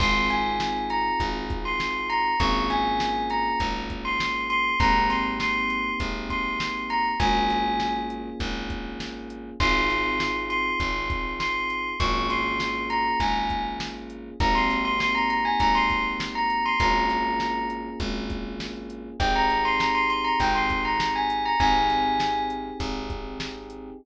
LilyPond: <<
  \new Staff \with { instrumentName = "Tubular Bells" } { \time 4/4 \key aes \major \tempo 4 = 100 c'''8 aes''4 bes''8 r8. c'''8. bes''8 | des'''8 aes''4 bes''8 r8. c'''8. c'''8 | bes''8 c'''16 r16 c'''4 r8 c'''4 bes''16 r16 | aes''4. r2 r8 |
c'''4. c'''4. c'''4 | des'''8 c'''4 bes''8 aes''8. r4 r16 | bes''16 c'''8 c'''16 c'''16 bes''16 bes''16 aes''16 bes''16 c'''8 r8 bes''8 c'''16 | bes''4. r2 r8 |
g''16 bes''8 c'''16 bes''16 c'''16 c'''16 bes''16 g''16 c'''8 bes''8 aes''8 bes''16 | aes''4. r2 r8 | }
  \new Staff \with { instrumentName = "Electric Piano 1" } { \time 4/4 \key aes \major <c' ees' f' aes'>1 | <bes des' f' aes'>1 | <bes c' ees' g'>1 | <bes des' f' aes'>1 |
<c' ees' f' aes'>1 | <bes des' f' aes'>1 | <bes c' ees' g'>1 | <bes des' f' aes'>1 |
<c' ees' g' aes'>1 | <c' ees' g' aes'>1 | }
  \new Staff \with { instrumentName = "Electric Bass (finger)" } { \clef bass \time 4/4 \key aes \major aes,,2 aes,,2 | aes,,2 aes,,2 | aes,,2 aes,,2 | aes,,2 aes,,2 |
aes,,2 aes,,2 | aes,,2 aes,,2 | aes,,2 aes,,2 | aes,,2 aes,,2 |
aes,,2 aes,,2 | aes,,2 aes,,2 | }
  \new DrumStaff \with { instrumentName = "Drums" } \drummode { \time 4/4 <cymc bd>8 <hh sn>8 sn8 hh8 <hh bd>8 <hh bd>8 sn8 hh8 | <hh bd>8 <hh sn>8 sn8 hh8 <hh bd>8 <hh bd>8 sn8 hh8 | <hh bd>8 <hh sn>8 sn8 hh8 <hh bd>8 <hh bd>8 sn8 hh8 | <hh bd>8 <hh sn>8 sn8 hh8 <hh bd>8 <hh bd sn>8 sn8 hh8 |
<cymc bd>8 <hh sn>8 sn8 hh8 <hh bd>8 <hh bd>8 sn8 hh8 | <hh bd>8 <hh sn>8 sn8 hh8 <hh bd>8 <hh bd>8 sn8 hh8 | <hh bd>8 <hh sn>8 sn8 hh8 <hh bd>8 <hh bd>8 sn8 hh8 | <hh bd>8 <hh sn>8 sn8 hh8 <hh bd>8 <hh bd sn>8 sn8 hh8 |
<hh bd>8 <hh sn>8 sn8 hh8 <hh bd>8 <hh bd>8 sn8 hh8 | <hh bd>8 <hh sn>8 sn8 hh8 <hh bd>8 <hh bd>8 sn8 hh8 | }
>>